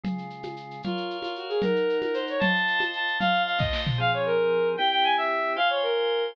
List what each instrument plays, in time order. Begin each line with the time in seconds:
0.04 drawbar organ C#3 G#3 F4, low conga, shaker
0.18 shaker
0.30 shaker
0.43 high conga, shaker
0.56 shaker
0.71 shaker
0.83 violin F4, drawbar organ A#4 C#5 F5, low conga, shaker
0.97 shaker
1.10 shaker
1.22 violin F4, high conga, shaker
1.35 violin F#4, shaker
1.49 violin G#4, shaker
1.62 drawbar organ D#4 A#4 F#5, violin A#4, low conga, shaker
1.76 shaker
1.89 shaker
2.02 violin A#4, high conga, shaker
2.14 violin C5, shaker
2.27 violin C#5, shaker
2.39 drawbar organ F4 C5 D#5 A5, violin A5, low conga, shaker
2.56 shaker
2.67 shaker
2.80 high conga, shaker
2.93 violin A5, shaker
3.07 shaker
3.19 drawbar organ F4 C5 D#5 A5, violin F5, low conga, shaker
3.34 shaker
3.46 violin F5, shaker
3.58 violin D#5, kick, snare
3.73 snare
3.87 floor tom
3.98 drawbar organ F3 C4 G#4, violin F5
4.14 violin C#5
4.26 violin A#4
4.77 drawbar organ C4 E4 G4, violin G5
4.91 violin G5
5.04 violin G#5
5.17 violin E5
5.56 drawbar organ F4 C5 G#5, violin F5
5.70 violin C#5
5.83 violin A#4